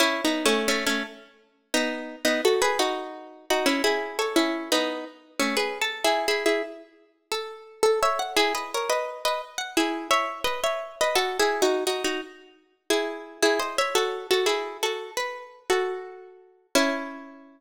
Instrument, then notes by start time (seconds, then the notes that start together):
acoustic guitar (steel)
0.00 C#4 E4
0.25 B3 D#4
0.45 A3 C#4
0.68 A3 C#4
0.86 A3 C#4
1.74 B3 D#4
2.25 B3 D#4
2.45 F#4 A4
2.62 G#4 B4
2.79 D#4 F#4
3.50 D#4 F#4
3.66 C#4 E4
3.84 E4 G#4
4.19 A4 C#5
4.36 C#4 E4
4.72 B3 D#4
5.40 A3 C#4
5.57 G#4 B4
5.82 A4
6.04 E4 G#4
6.28 E4 G#4
6.46 E4 G#4
7.32 A4
7.83 A4
8.03 C#5 E5
8.19 F#5
8.36 E4 G#4
8.55 B4 D#5
8.74 A#4 C#5
8.90 B4 D#5
9.25 B4 D#5
9.58 F#5
9.77 E4 G#4
10.11 C#5 E5
10.44 B4 D#5
10.64 C#5 E5
11.01 B4 D#5
11.15 F#4 A4
11.40 E4 G#4
11.62 D#4 F#4
11.87 D#4 F#4
12.04 D#4 F#4
12.90 E4 G#4
13.42 E4 G#4
13.59 C5 D#5
13.78 C#5 E5
13.95 F#4 A4
14.31 F#4 A4
14.46 E4 G#4
14.83 F#4 A4
15.17 B4
15.70 F#4 A4
16.75 C#4 E4